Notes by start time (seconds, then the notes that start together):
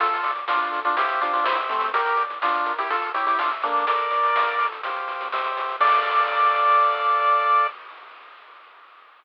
0.00 D2 F4 A4, kick, closed hi-hat
0.14 closed hi-hat
0.23 D3 D5, closed hi-hat
0.35 closed hi-hat
0.48 D2 D4 F4 F5, snare
0.62 closed hi-hat
0.72 D3 A4, closed hi-hat
0.84 D4 F4, closed hi-hat
0.96 C2 E4 G4 C5 F5, kick, closed hi-hat
1.09 closed hi-hat
1.21 C3 D4 F4, closed hi-hat
1.33 D4 F4, closed hi-hat
1.44 C2 C4 E4 G4 C5 E5, snare
1.56 closed hi-hat
1.69 C3 A3 C4, closed hi-hat
1.81 closed hi-hat
1.93 G4 A#4, kick, closed hi-hat
2.06 closed hi-hat
2.17 D5, closed hi-hat
2.30 kick, closed hi-hat
2.41 D4 F4 F5, snare
2.54 closed hi-hat
2.66 A#4, closed hi-hat
2.78 E4 G4, closed hi-hat
2.89 F4 A4, kick, closed hi-hat
3.02 closed hi-hat
3.14 E4 G4 C#5, closed hi-hat
3.26 E4 G4, closed hi-hat
3.39 D4 F4 E5, snare
3.51 closed hi-hat
3.62 A#3 D4 A4, closed hi-hat
3.76 closed hi-hat
3.87 A1 A4 A#4 D5, kick, closed hi-hat
3.98 closed hi-hat
4.11 A2 D5, closed hi-hat
4.23 closed hi-hat
4.35 A1 F5, snare
4.47 closed hi-hat
4.58 A2 A4, closed hi-hat
4.72 closed hi-hat
4.83 C2 G4 C5 F5, kick, closed hi-hat
4.96 closed hi-hat
5.08 C3, closed hi-hat
5.20 kick, closed hi-hat
5.31 C2 G4 C5 E5, snare
5.44 closed hi-hat
5.56 C3, closed hi-hat
5.69 closed hi-hat
5.80 D2 A4 D5 F5, kick, crash